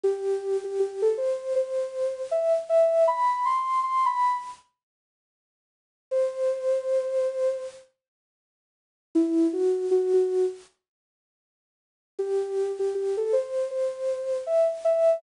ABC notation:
X:1
M:4/4
L:1/16
Q:"Swing 16ths" 1/4=79
K:Em
V:1 name="Ocarina"
G3 G G A c2 c4 e z e2 | b2 c'2 c' b2 z9 | c8 z8 | E2 F2 F F2 z9 |
G3 G G A c2 c4 e z e2 |]